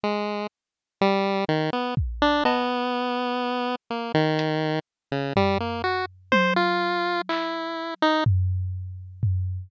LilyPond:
<<
  \new Staff \with { instrumentName = "Lead 1 (square)" } { \time 5/8 \tempo 4 = 62 gis8 r8 g8 dis16 b16 r16 d'16 | b4. ais16 dis8. | r16 cis16 g16 ais16 fis'16 r16 c''16 f'8. | e'8. dis'16 r4. | }
  \new DrumStaff \with { instrumentName = "Drums" } \drummode { \time 5/8 r4. r8 bd8 | cb4. r8 hh8 | r8 tomfh4 tommh4 | hc4 tomfh8 r8 tomfh8 | }
>>